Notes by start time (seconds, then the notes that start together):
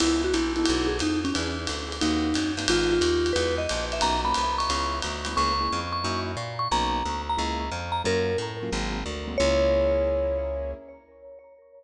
0.00 C#2 B3 C#4 E4 G#4, crash, ride
0.24 F#4
0.34 A#1 E4, hi-hat pedal, ride
0.56 B3 D#4 E4 F#4 A4, ride
0.66 B1, ride
0.87 G#4
0.99 F2 D#4, hi-hat pedal, ride
1.25 C#4, ride
1.34 E2 B3 D4 E4 G#4, ride
1.59 B3 D4 E4 G#4
1.67 D2, hi-hat pedal, ride
1.88 B3 D4 E4 G#4
1.92 ride
2.01 D#2 A#3 C4 D#4 F#4, ride
2.34 F#2 A#3 C4 D#4 F#4, hi-hat pedal, ride
2.57 G2 A#3 C4 D#4 F#4, ride
2.68 G#1 G#3 B3 D#4 F4, ride
2.92 F4
3.01 D#2, hi-hat pedal, ride
3.26 ride
3.33 E2 G#3 D#4 E4 F#4 B4, ride
3.58 D#5
3.69 A#1, hi-hat pedal, ride
3.92 E5, ride
4.01 B1 A#3 B3 C#4 D#4 A#5, ride
4.25 A#3 B3 C#4 D#4 B5
4.34 C2, hi-hat pedal, ride
4.58 C#6, ride
4.69 C#2 G#3 B3 C#4 E4, ride
5.02 D2, ride
5.25 G#3 B3 C#4 E4, hi-hat pedal, ride
5.36 C#2 A#3 C#4 E4 G#4 C#6
5.60 A#3 C#4 E4 G#4
5.72 F2
5.93 C#6
6.04 F#2 A#3 D#4 E4 F#4
6.37 A#2
6.59 C#6
6.71 B1 A#3 B3 C#4 D#4 A#5
7.05 D2
7.29 A#5
7.37 C#2 G#3 A#3 C#4 E4
7.72 F2
7.92 A#5
8.04 F#2 F#3 A#3 C#4 F4 A#4
8.38 A2
8.63 F#3 A#3 C#4 F4
8.72 G#1 F#3 G#3 A#3 C4
9.06 D2
9.28 F#3 G#3 A#3 C4
9.38 C#2 A#3 C#4 E4 G#4 C#5